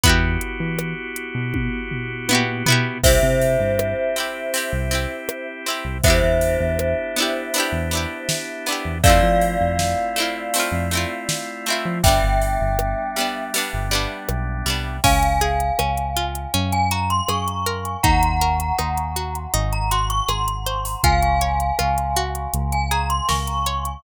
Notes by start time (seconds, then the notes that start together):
0.03 E2 B3 E4 F#4 G4, kick, closed hi-hat
0.09 G4
0.41 closed hi-hat
0.60 E3
0.79 cross-stick
1.16 closed hi-hat
1.35 B2
1.54 kick, high tom
1.91 floor tom
2.29 A#2 B3 E4, high tom
2.33 F#4 G4
2.66 B2 B3 E4, floor tom
2.70 F#4 G4
3.03 C2 C4 E4 G4 C5 E5, kick, crash
3.08 G4
3.23 C3
3.41 ride
3.60 G2
3.79 cross-stick
4.16 C4 E4 G4, ride
4.54 C4 E4 G4, ride
4.73 C2
4.91 C4 E4 G4, ride
5.29 cross-stick
5.66 C4 E4 G4, ride
5.85 C2
6.03 E2 B3 D4 E4 G4 C5 E5, kick, ride
6.08 E4 G4
6.23 E2
6.41 ride
6.60 E2
6.79 cross-stick
7.16 B3 D4 E4, ride
7.22 G4
7.54 B3 D4, ride
7.58 E4 G4
7.72 E2
7.91 B3 D4 E4, ride
7.97 G4
8.29 snare
8.66 B3 D4, ride
8.70 E4 G4
8.85 E2
9.03 F2 A3 C4 E4 F4 D5 F5, kick, ride
9.08 E4 F4
9.23 F3
9.41 ride
9.61 F2
9.79 snare
10.16 A3 C4 E4, ride
10.22 F4
10.54 A3 C4, ride
10.58 E4 F4
10.72 F2
10.91 A3 C4 E4, ride
10.97 F4
11.29 snare
11.66 A3 C4, ride
11.70 E4 F4
11.85 F3
12.03 G1 G3 B3 D4 E5 G5, kick, ride
12.08 D4
12.23 G1
12.41 ride
12.61 G1
12.79 cross-stick
13.16 G3 B3, ride
13.20 D4
13.54 G3 B3 D4, ride
13.73 G1
13.91 G3 B3 D4, ride
14.29 B1, cross-stick
14.66 C2 G3 B3, ride
14.70 D4
15.04 C#2 C#4 F5 G#5, kick, crash
15.23 closed hi-hat
15.41 G#4, closed hi-hat
15.60 closed hi-hat
15.79 C#2 C#4, cross-stick
15.97 closed hi-hat
16.16 F4, closed hi-hat
16.35 closed hi-hat
16.54 F#2 C#4, closed hi-hat
16.72 G#5, closed hi-hat
16.91 F#4 A#5, closed hi-hat
17.10 C6, closed hi-hat
17.28 F#2 G#4 C#6, cross-stick
17.48 closed hi-hat
17.66 A#4, closed hi-hat
17.85 closed hi-hat
18.03 D#2 D#4 F#5 A#5, kick, closed hi-hat
18.23 closed hi-hat
18.41 A#4, closed hi-hat
18.60 closed hi-hat
18.78 D#2 D#4, cross-stick
18.98 closed hi-hat
19.16 F#4, closed hi-hat
19.35 closed hi-hat
19.54 G#1 D#4, closed hi-hat
19.73 A#5, closed hi-hat
19.91 F#4 C6, closed hi-hat
20.10 C#6, closed hi-hat
20.28 G#1 G#4 C6, cross-stick
20.48 closed hi-hat
20.66 C5, closed hi-hat
20.85 open hi-hat
21.04 C#2 F4 F5 G#5, kick, closed hi-hat
21.22 closed hi-hat
21.41 C#5, closed hi-hat
21.60 closed hi-hat
21.79 C#2 F4, cross-stick
21.98 closed hi-hat
22.16 F#4, closed hi-hat
22.35 closed hi-hat
22.53 C#2, closed hi-hat
22.72 G#5, closed hi-hat
22.91 G#4 A#5, closed hi-hat
23.10 C6, closed hi-hat
23.29 C#2 A#4 C#6, snare
23.47 closed hi-hat
23.66 C#5, closed hi-hat
23.85 closed hi-hat